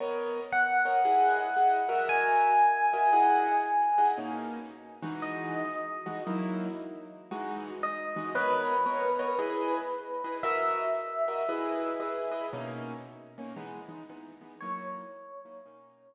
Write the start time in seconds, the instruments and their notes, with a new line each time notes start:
0.00 acoustic grand piano B3 A#4 C#5 D#5
0.52 electric piano 1 F#5
0.85 acoustic grand piano B3 A#4 C#5 D#5
1.04 acoustic grand piano E4 G#4 D#5 F#5
1.56 acoustic grand piano E4 G#4 D#5 F#5
1.89 acoustic grand piano F#4 A#4 D#5 E5
2.09 electric piano 1 G#5
2.93 acoustic grand piano F#4 A#4 D#5 E5
3.12 acoustic grand piano E4 G#4 D#5 F#5
3.98 acoustic grand piano E4 G#4 D#5 F#5
4.17 acoustic grand piano B2 A#3 C#4 D#4
5.02 acoustic grand piano E3 G#3 D#4 F#4
5.22 electric piano 1 D#5
6.06 acoustic grand piano E3 G#3 D#4 F#4
6.26 acoustic grand piano F#3 A#3 D#4 E4
7.31 acoustic grand piano E3 G#3 D#4 F#4
7.83 electric piano 1 D#5
8.16 acoustic grand piano E3 G#3 D#4 F#4
8.35 acoustic grand piano B3 A#4 C#5 D#5, electric piano 1 B4
8.86 acoustic grand piano B3 A#4 C#5 D#5
9.19 acoustic grand piano B3 A#4 C#5 D#5
9.38 acoustic grand piano E4 G#4 B4 D#5
10.24 acoustic grand piano E4 G#4 B4 D#5
10.43 acoustic grand piano F#4 A#4 D#5 E5, electric piano 1 E5
11.28 acoustic grand piano F#4 A#4 D#5 E5
11.48 acoustic grand piano E4 G#4 B4 D#5
12.00 acoustic grand piano E4 G#4 B4 D#5
12.31 acoustic grand piano E4 G#4 B4 D#5
12.52 acoustic grand piano B2 A#3 C#4 D#4
13.38 acoustic grand piano B2 A#3 C#4 D#4
13.56 acoustic grand piano E3 G#3 B3 D#4
13.88 acoustic grand piano E3 G#3 B3 D#4
14.09 acoustic grand piano E3 G#3 B3 D#4
14.41 acoustic grand piano E3 G#3 B3 D#4
14.61 acoustic grand piano F#3 A#3 D#4 E4, electric piano 1 C#5
15.45 acoustic grand piano F#3 A#3 D#4 E4
15.65 acoustic grand piano B2 A#3 C#4 D#4